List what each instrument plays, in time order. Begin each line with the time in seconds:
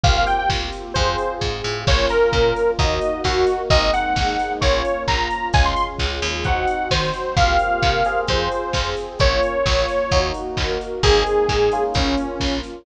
0.04 electric bass (finger) C2, electric piano 1 A#3 C4 F4 G4, pad 2 (warm) A#3 C4 F4 G4, lead 2 (sawtooth) F5, kick, closed hi-hat
0.17 lead 2 (sawtooth) F5
0.27 lead 2 (sawtooth) G5, open hi-hat
0.38 lead 2 (sawtooth) G5
0.50 electric bass (finger) C2, kick, snare
0.72 open hi-hat
0.94 electric bass (finger) F2, pad 2 (warm) C4 F4 G#4, electric piano 1 C4 F4 G#4, lead 2 (sawtooth) C5, kick, closed hi-hat
1.18 open hi-hat
1.41 electric bass (finger) G#2, kick, snare
1.64 electric bass (finger) A2
1.87 electric bass (finger) A#1, pad 2 (warm) A#3 C#4 F4, electric piano 1 A#3 C#4 F4, lead 2 (sawtooth) C#5, kick, crash
2.09 lead 2 (sawtooth) A#4, open hi-hat
2.32 electric bass (finger) A#2, pad 2 (warm) F3 A#3 F4, kick, clap
2.56 open hi-hat
2.79 electric bass (finger) D#2, pad 2 (warm) A#3 D#4 F#4, electric piano 1 A#3 D#4 F#4, lead 2 (sawtooth) D#5, kick, closed hi-hat
3.01 open hi-hat
3.24 electric bass (finger) D#2, pad 2 (warm) A#3 F#4 A#4, lead 2 (sawtooth) F#4, kick, snare
3.47 open hi-hat
3.70 electric bass (finger) G#1, pad 2 (warm) G#3 A#3 C4 D#4, electric piano 1 G#3 A#3 C4 D#4, lead 2 (sawtooth) D#5, kick, closed hi-hat
3.93 lead 2 (sawtooth) F#5, open hi-hat
4.16 electric bass (finger) G#1, pad 2 (warm) G#3 A#3 D#4 G#4, kick, snare
4.39 open hi-hat
4.61 electric bass (finger) A#1, electric piano 1 A#3 C#4 F4, pad 2 (warm) A#3 C#4 F4, lead 2 (sawtooth) C#5, kick, closed hi-hat
4.85 open hi-hat
5.07 electric bass (finger) A#1, pad 2 (warm) F3 A#3 F4, lead 2 (sawtooth) A#5, kick, clap
5.30 open hi-hat
5.53 electric bass (finger) C#2, pad 2 (warm) G#3 C#4 F4, electric piano 1 G#3 C#4 F4, lead 2 (sawtooth) G#5, kick, closed hi-hat
5.65 lead 2 (sawtooth) C6
5.76 lead 2 (sawtooth) C6, open hi-hat
5.99 electric bass (finger) C#2, pad 2 (warm) G#3 F4 G#4, kick, clap
6.22 electric bass (finger) D#2, open hi-hat
6.44 pad 2 (warm) C4 D#4 F#4, electric piano 1 C4 D#4 F#4, lead 2 (sawtooth) F#5, kick, closed hi-hat
6.67 open hi-hat
6.91 electric bass (finger) D#3, pad 2 (warm) F#3 C4 F#4, lead 2 (sawtooth) C5, kick, snare
7.14 open hi-hat
7.36 electric bass (finger) C2, electric piano 1 A#3 C4 F4 G4, pad 2 (warm) A#3 C4 F4 G4, lead 2 (sawtooth) F5, kick, closed hi-hat
7.59 open hi-hat
7.83 electric bass (finger) C3, pad 2 (warm) A#3 C4 G4 A#4, kick, clap
8.05 electric piano 1 C4 F4 G#4, open hi-hat
8.28 electric bass (finger) F2, pad 2 (warm) C4 F4 G#4, lead 2 (sawtooth) C5, kick, closed hi-hat
8.52 open hi-hat
8.73 electric bass (finger) F2, pad 2 (warm) C4 G#4 C5, kick, snare
8.97 open hi-hat
9.19 electric bass (finger) A#1, electric piano 1 A#3 C#4 F4, pad 2 (warm) A#3 C#4 F4, lead 2 (sawtooth) C#5, kick, closed hi-hat
9.43 open hi-hat
9.66 electric bass (finger) A#1, pad 2 (warm) F3 A#3 F4, kick, snare
9.88 open hi-hat
10.11 electric bass (finger) D#2, electric piano 1 A#3 D#4 F#4, pad 2 (warm) A#3 D#4 F#4, kick, closed hi-hat
10.34 open hi-hat
10.57 electric bass (finger) D#2, pad 2 (warm) A#3 F#4 A#4, kick, clap
10.81 open hi-hat
11.03 electric bass (finger) G#1, pad 2 (warm) G#3 A#3 C4 D#4, electric piano 1 G#3 A#3 C4 D#4, lead 2 (sawtooth) G#4, kick, closed hi-hat
11.27 open hi-hat
11.49 electric bass (finger) G#2, pad 2 (warm) G#3 A#3 D#4 G#4, kick, clap
11.72 electric piano 1 A#3 C#4 F4, open hi-hat
11.94 electric bass (finger) A#1, pad 2 (warm) A#3 C#4 F4, lead 2 (sawtooth) C#4, kick, closed hi-hat
12.17 open hi-hat
12.40 electric bass (finger) A#1, pad 2 (warm) F3 A#3 F4, kick, snare
12.63 open hi-hat